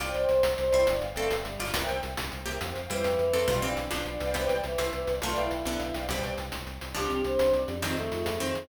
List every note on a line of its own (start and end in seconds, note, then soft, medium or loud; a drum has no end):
0.00 0.12 C2 medium
0.00 0.67 F4 medium
0.00 0.23 C5 loud
0.00 0.11 D5 medium
0.00 0.67 D5 medium
0.00 0.23 D5 loud
0.00 0.23 G5 medium
0.00 closed hi-hat loud
0.14 0.26 C2 medium
0.14 0.41 C5 medium
0.14 closed hi-hat medium
0.29 0.42 C2 medium
0.29 closed hi-hat medium
0.43 0.55 C2 medium
0.43 closed hi-hat loud
0.57 0.71 C2 medium
0.57 0.85 C5 medium
0.57 0.64 C5 medium
0.57 0.64 D5 medium
0.57 closed hi-hat medium
0.61 0.82 C5 medium
0.61 0.64 G5 medium
0.66 0.82 D5 medium
0.66 0.82 G5 medium
0.73 0.85 C2 medium
0.73 0.86 E4 medium
0.73 0.86 C5 medium
0.73 closed hi-hat medium
0.86 1.00 G1 medium
0.86 1.01 D4 medium
0.86 0.92 B4 loud
0.86 0.92 D5 loud
0.86 0.92 F5 loud
0.86 closed hi-hat loud
0.90 0.93 G5 medium
0.95 1.06 B4 medium
0.95 1.06 D5 medium
0.95 1.06 F5 medium
0.99 1.14 G1 medium
0.99 1.06 G5 medium
0.99 closed hi-hat medium
1.09 1.33 B4 medium
1.09 1.33 D5 medium
1.09 1.33 F5 medium
1.13 1.28 G1 medium
1.13 1.28 A3 medium
1.13 1.55 C4 medium
1.13 1.55 A4 loud
1.13 1.33 G5 medium
1.13 closed hi-hat medium
1.30 1.43 G1 medium
1.30 closed hi-hat loud
1.45 1.57 G1 medium
1.45 1.57 G3 medium
1.45 closed hi-hat medium
1.59 1.72 G1 medium
1.59 1.74 F4 medium
1.59 1.74 D5 loud
1.59 open hi-hat medium
1.74 1.86 C2 medium
1.74 2.36 D4 medium
1.74 2.36 A#4 medium
1.74 1.97 A#4 medium
1.74 1.97 C5 medium
1.74 1.97 E5 medium
1.74 closed hi-hat loud
1.78 1.97 G5 loud
1.88 2.01 C2 medium
1.88 closed hi-hat medium
2.03 2.16 C2 medium
2.03 closed hi-hat medium
2.17 2.30 C2 medium
2.17 closed hi-hat loud
2.32 2.45 C2 medium
2.32 2.37 A#4 medium
2.32 2.37 C5 medium
2.32 2.37 E5 medium
2.32 closed hi-hat medium
2.36 2.39 G5 medium
2.40 2.57 A#4 medium
2.40 2.57 C5 medium
2.40 2.57 E5 medium
2.44 2.58 C2 medium
2.44 2.59 A#3 medium
2.44 2.59 G4 medium
2.44 2.57 G5 medium
2.44 closed hi-hat medium
2.61 2.73 F2 medium
2.61 2.67 C5 loud
2.61 2.67 F5 loud
2.61 2.67 G5 medium
2.61 closed hi-hat loud
2.69 2.80 C5 medium
2.69 2.80 F5 medium
2.69 2.80 G5 medium
2.75 2.88 F2 medium
2.75 closed hi-hat medium
2.82 3.05 C5 medium
2.82 3.05 F5 medium
2.82 3.05 G5 medium
2.89 3.03 F2 medium
2.89 3.17 E3 medium
2.89 3.32 G3 medium
2.89 3.32 E4 medium
2.89 closed hi-hat loud
3.04 3.16 F2 medium
3.04 closed hi-hat loud
3.18 3.31 F2 medium
3.18 3.46 E3 medium
3.18 closed hi-hat medium
3.33 3.46 F2 medium
3.33 3.47 C4 medium
3.33 3.47 A4 loud
3.33 closed hi-hat medium
3.47 3.60 B1 medium
3.47 3.60 B2 medium
3.47 3.60 G3 loud
3.47 3.60 F4 medium
3.47 3.71 B4 medium
3.47 3.71 D5 medium
3.47 3.71 F5 loud
3.47 closed hi-hat loud
3.52 3.71 G5 medium
3.62 3.75 B1 medium
3.62 3.89 E3 medium
3.62 3.89 C4 medium
3.62 3.86 D4 medium
3.62 closed hi-hat medium
3.77 3.89 B1 medium
3.77 closed hi-hat medium
3.91 4.04 B1 medium
3.91 4.29 F3 medium
3.91 4.29 D4 medium
3.91 3.97 B4 medium
3.91 3.97 D5 medium
3.91 3.97 F5 medium
3.91 closed hi-hat loud
3.96 4.10 B4 medium
3.96 3.99 G5 medium
4.00 4.10 D5 medium
4.00 4.10 F5 medium
4.00 4.10 G5 medium
4.05 4.18 B1 medium
4.05 4.35 D4 medium
4.05 closed hi-hat medium
4.14 4.31 B4 medium
4.14 4.31 D5 medium
4.14 4.31 F5 medium
4.18 4.47 C2 medium
4.18 4.31 G5 medium
4.18 closed hi-hat medium
4.34 4.48 E3 medium
4.34 4.75 B3 medium
4.34 4.75 G4 medium
4.34 4.58 C5 loud
4.34 4.58 D5 medium
4.34 4.58 G5 loud
4.34 closed hi-hat loud
4.49 4.62 C2 medium
4.49 closed hi-hat medium
4.64 4.76 C2 medium
4.64 4.77 E3 medium
4.64 closed hi-hat medium
4.78 4.90 C2 medium
4.78 5.16 E4 medium
4.78 5.16 C5 medium
4.78 closed hi-hat loud
4.93 5.05 C2 medium
4.93 5.06 E3 medium
4.93 closed hi-hat medium
5.07 5.20 C2 medium
5.07 5.13 C5 medium
5.07 5.13 D5 medium
5.07 5.13 G5 medium
5.07 closed hi-hat medium
5.15 5.21 C5 medium
5.15 5.21 D5 medium
5.15 5.21 G5 medium
5.22 5.34 B1 medium
5.22 5.65 A3 loud
5.22 5.35 F4 medium
5.22 5.65 F4 loud
5.22 5.46 B4 loud
5.22 5.46 D5 loud
5.22 5.46 F5 medium
5.22 closed hi-hat loud
5.27 5.46 G5 medium
5.36 5.48 B1 medium
5.36 5.95 E4 medium
5.36 closed hi-hat medium
5.51 5.63 B1 medium
5.51 closed hi-hat medium
5.65 5.77 B1 medium
5.65 6.05 D3 medium
5.65 6.05 B3 medium
5.65 5.71 B4 medium
5.65 5.71 D5 medium
5.65 5.71 F5 medium
5.65 closed hi-hat medium
5.70 5.84 B4 medium
5.70 5.73 G5 medium
5.74 5.84 D5 medium
5.74 5.84 F5 medium
5.74 5.84 G5 medium
5.80 5.92 B1 medium
5.80 closed hi-hat medium
5.87 6.04 B4 medium
5.87 6.04 D5 medium
5.87 6.04 F5 medium
5.91 6.07 B1 medium
5.91 6.04 G5 medium
5.91 closed hi-hat loud
6.09 6.21 C2 medium
6.09 6.46 B2 medium
6.09 6.46 G3 medium
6.09 6.32 C5 medium
6.09 6.32 D5 loud
6.09 6.32 G5 loud
6.09 closed hi-hat loud
6.23 6.36 C2 medium
6.23 closed hi-hat medium
6.38 6.50 C2 medium
6.38 closed hi-hat medium
6.52 6.65 C2 medium
6.52 closed hi-hat loud
6.66 6.79 C2 medium
6.66 closed hi-hat medium
6.80 6.93 C2 medium
6.80 6.86 C5 medium
6.80 6.86 D5 medium
6.80 6.86 G5 medium
6.80 closed hi-hat medium
6.88 6.94 C5 medium
6.88 6.94 D5 medium
6.88 6.94 G5 medium
6.95 7.08 C2 medium
6.95 7.68 F3 medium
6.95 7.20 C4 medium
6.95 7.68 D4 medium
6.95 7.20 D4 loud
6.95 7.23 G4 medium
6.95 closed hi-hat loud
7.00 7.20 G4 medium
7.10 7.22 C2 medium
7.10 closed hi-hat medium
7.24 7.37 C2 medium
7.24 7.48 C4 medium
7.24 7.48 D4 medium
7.24 7.48 G4 medium
7.24 7.52 C5 medium
7.24 closed hi-hat medium
7.39 7.52 C2 medium
7.39 closed hi-hat loud
7.53 7.65 C2 medium
7.53 7.78 D5 medium
7.53 closed hi-hat medium
7.61 7.73 C4 medium
7.61 7.73 D4 medium
7.61 7.73 G4 medium
7.68 7.95 F2 medium
7.68 closed hi-hat medium
7.75 7.81 C4 medium
7.75 7.81 D4 medium
7.75 7.81 G4 medium
7.82 8.39 D#3 medium
7.82 7.94 C4 loud
7.82 8.39 C4 medium
7.82 7.96 D#4 medium
7.82 7.94 D#4 medium
7.82 7.94 F4 loud
7.82 closed hi-hat loud
7.86 7.94 G#4 loud
7.96 8.10 F2 medium
7.96 8.38 A3 medium
7.96 8.03 C4 medium
7.96 8.03 D#4 medium
7.96 8.03 F4 medium
7.96 closed hi-hat medium
8.01 8.28 C4 medium
8.01 8.04 G#4 medium
8.06 8.28 D#4 medium
8.06 8.28 F4 medium
8.06 8.28 G#4 medium
8.11 8.24 F2 medium
8.11 closed hi-hat medium
8.26 8.38 F2 medium
8.26 closed hi-hat loud
8.40 8.53 F2 medium
8.40 8.67 D#3 medium
8.40 8.67 C4 medium
8.40 8.65 C4 medium
8.40 8.65 D#4 medium
8.40 8.65 F4 medium
8.40 closed hi-hat medium
8.45 8.65 G#4 medium
8.55 8.67 F2 medium
8.55 closed hi-hat medium